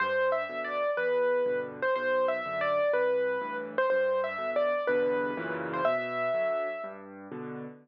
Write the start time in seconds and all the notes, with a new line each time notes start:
0.00 G2 C5
0.32 E5
0.49 B2 D3
0.64 D5
0.97 E2 B4
1.46 G2 B2 D3
1.82 C5
1.96 B1 C5
2.28 E5
2.45 F#2 D3
2.61 D5
2.93 C2 B4
3.41 G2 A2 E3
3.78 C5
3.90 G2 C5
4.24 E5
4.38 B2 D3
4.56 D5
4.87 E2 G2 B2 D3 B4
5.37 F#2 A#2 C#3 E3
5.73 C5
5.85 B2 E5
6.34 D3 F#3
6.84 G2
7.32 B2 D3